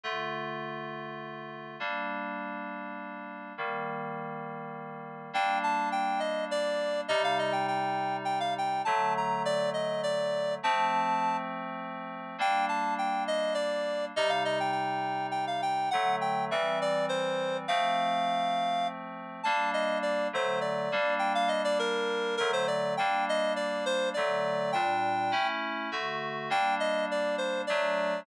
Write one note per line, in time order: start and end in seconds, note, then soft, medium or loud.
0.04 1.76 D3 medium
0.04 1.76 A3 medium
0.04 1.76 F4 medium
1.80 3.53 G3 medium
1.80 3.53 A#3 medium
1.80 3.53 D4 medium
3.58 5.31 D#3 medium
3.58 5.31 G3 medium
3.58 5.31 A#3 medium
5.33 7.06 G3 medium
5.33 7.06 A#3 medium
5.33 7.06 D4 medium
5.33 5.58 G5 medium
5.63 5.89 A5 medium
5.92 6.20 G5 medium
6.20 6.45 D#5 medium
6.51 7.01 D5 medium
7.08 8.81 C3 medium
7.08 8.81 G3 medium
7.08 8.81 D#4 medium
7.08 7.22 D#5 medium
7.24 7.38 F5 medium
7.39 7.53 D#5 medium
7.52 7.66 G5 medium
7.68 8.17 G5 medium
8.25 8.39 G5 medium
8.40 8.54 F5 medium
8.58 8.82 G5 medium
8.85 10.59 D3 medium
8.85 10.59 F#3 medium
8.85 10.59 A3 medium
8.85 9.14 A5 medium
9.17 9.43 A#5 medium
9.45 9.70 D5 medium
9.74 10.02 D#5 medium
10.03 10.54 D5 medium
10.63 12.36 F3 medium
10.63 12.36 A3 medium
10.63 12.36 C4 medium
10.63 11.37 A5 medium
12.38 14.11 G3 medium
12.38 14.11 A#3 medium
12.38 14.11 D4 medium
12.38 12.66 G5 medium
12.69 12.94 A5 medium
12.98 13.24 G5 medium
13.28 13.54 D#5 medium
13.54 14.05 D5 medium
14.16 15.89 C3 medium
14.16 15.89 G3 medium
14.16 15.89 D#4 medium
14.16 14.30 D#5 medium
14.29 14.43 F5 medium
14.45 14.59 D#5 medium
14.60 14.71 G5 medium
14.72 15.27 G5 medium
15.31 15.45 G5 medium
15.47 15.61 F5 medium
15.62 15.89 G5 medium
15.91 16.50 D3 medium
15.91 16.50 F#3 medium
15.91 16.50 A3 medium
15.91 16.16 F#5 medium
16.21 16.45 G5 medium
16.51 17.66 E3 medium
16.51 17.66 G3 medium
16.51 17.66 C4 medium
16.51 16.79 E5 medium
16.82 17.06 D5 medium
17.09 17.57 C5 medium
17.68 19.41 F3 medium
17.68 19.41 A3 medium
17.68 19.41 C4 medium
17.68 18.88 F5 medium
19.43 20.28 G3 medium
19.43 20.28 A#3 medium
19.43 20.28 D4 medium
19.43 19.70 A5 medium
19.74 19.98 D#5 medium
20.03 20.28 D5 medium
20.33 20.89 D3 medium
20.33 20.89 F#3 medium
20.33 20.89 A3 medium
20.33 20.59 C5 medium
20.61 21.14 D5 medium
20.92 22.37 G3 medium
20.92 22.37 A#3 medium
20.92 22.37 D4 medium
21.19 21.33 G5 medium
21.35 21.49 F5 medium
21.48 21.62 D#5 medium
21.64 21.78 D5 medium
21.79 22.36 A#4 medium
22.37 22.97 D3 medium
22.37 22.97 F#3 medium
22.37 22.97 A3 medium
22.37 22.51 A#4 medium
22.53 22.67 C5 medium
22.68 22.94 D5 medium
22.97 24.14 G3 medium
22.97 24.14 A#3 medium
22.97 24.14 D4 medium
22.97 23.25 G5 medium
23.29 23.53 D#5 medium
23.56 23.85 D5 medium
23.86 24.09 C5 medium
24.14 24.74 D3 medium
24.14 24.74 F#3 medium
24.14 24.74 A3 medium
24.14 24.71 D5 medium
24.72 25.31 A#2 medium
24.72 25.31 G3 medium
24.72 25.31 D4 medium
24.72 25.48 G5 medium
25.32 25.89 A3 medium
25.32 25.89 C#4 medium
25.32 25.89 E4 medium
25.92 26.49 D3 medium
25.92 26.49 A3 medium
25.92 26.49 F#4 medium
26.50 27.65 G3 medium
26.50 27.65 A#3 medium
26.50 27.65 D4 medium
26.50 26.75 G5 medium
26.80 27.05 D#5 medium
27.11 27.36 D5 medium
27.38 27.62 C5 medium
27.67 28.26 F#3 medium
27.67 28.26 A3 medium
27.67 28.26 D4 medium
27.67 28.20 D5 medium